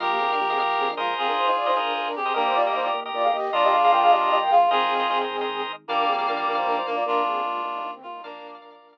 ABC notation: X:1
M:6/8
L:1/16
Q:3/8=102
K:Bbmix
V:1 name="Flute"
[A,F] [B,G] [CA] [DB] [B,G] [CA] z2 [CA] [DB] [A,F]2 | [CA] [DB] [Ec] [Ec] [Fd] [Ec] [DB]2 [DB] [DB] [CA]2 | [DB] [Ec] [Fd] [Ge] [Ec] [Fd] z2 [Fd] [Af] [Ge]2 | [Fd] [Ge] [Af] [Af] [Bg] [Af] [Ge]2 [Ge] [Bg] [Af]2 |
[CA]10 z2 | [DB]2 [CA]2 [DB]2 [DB] [Ec] [DB] [Ec] [DB] [Fd] | [DB]2 [CA]2 [A,F]2 [A,F] [G,E] [F,D] [E,C] [A,F] [G,E] | [DB]10 z2 |]
V:2 name="Clarinet"
[GB]10 B2 | [FA]10 G2 | [G,B,]6 z6 | [DF]10 F2 |
[FA]6 z6 | [G,B,]10 B,2 | [DF]10 F2 | [B,D]4 z8 |]
V:3 name="Drawbar Organ"
[Bef]5 [Bef] [Bef]4 [ABce]2- | [ABce]5 [ABce] [ABce]5 [ABce] | [GBe]3 [GBe] [GBe] [GBe]2 [GBe]5 | [FBe]3 [FBe] [FBe] [FBe]2 [FBe]5 |
[ABce]3 [ABce] [ABce] [ABce]2 [ABce]5 | [Bdf]3 [Bdf] [Bdf] [Bdf]2 [Bdf]5 | z12 | [Bdf]3 [Bdf] [Bdf] [Bdf]2 [Bdf]5 |]
V:4 name="Drawbar Organ" clef=bass
B,,,2 B,,,2 B,,,2 B,,,2 B,,,2 B,,,2 | z12 | E,,2 E,,2 E,,2 E,,2 E,,2 E,,2 | B,,,2 B,,,2 B,,,2 B,,,2 B,,,2 B,,,2 |
A,,,2 A,,,2 A,,,2 A,,,2 A,,,2 A,,,2 | B,,,2 B,,,2 B,,,2 B,,,2 B,,,2 B,,,2 | E,,2 E,,2 E,,2 E,,2 E,,2 E,,2 | B,,,2 B,,,2 B,,,2 B,,,2 z4 |]